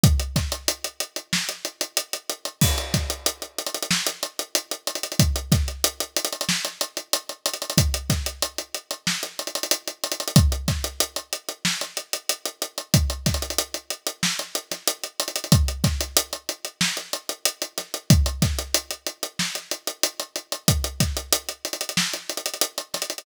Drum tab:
CC |--------------------------------|x-------------------------------|--------------------------------|--------------------------------|
HH |x-x-x-x-x-x-x-x---x-x-x-x-x-x-x-|--x-x-x-x-x-xxxx--x-x-x-x-x-xxxx|x-x-x-x-x-x-xxxx--x-x-x-x-x-xxxx|x-x-x-x-x-x-x-x---x-xxxxx-x-xxxx|
SD |----o-----------o---------------|----o-----------o---------------|----o-----------o---------------|----o-----------o---------------|
BD |o---o---------------------------|o---o---------------------------|o---o---------------------------|o---o---------------------------|

CC |--------------------------------|--------------------------------|--------------------------------|--------------------------------|
HH |x-x-x-x-x-x-x-x---x-x-x-x-x-x-x-|x-x-xxxxx-x-x-x---x-x-x-x-x-xxxx|x-x-x-x-x-x-x-x---x-x-x-x-x-x-x-|x-x-x-x-x-x-x-x---x-x-x-x-x-x-x-|
SD |----o-----------o---------------|----o-----------o-----o---------|----o-----------o-----------o---|----o-----------o---------------|
BD |o---o---------------------------|o---o---------------------------|o---o---------------------------|o---o---------------------------|

CC |--------------------------------|
HH |x-x-x-x-x-x-xxxx--x-xxxxx-x-xxxx|
SD |----o-----------o-----------o---|
BD |o---o---------------------------|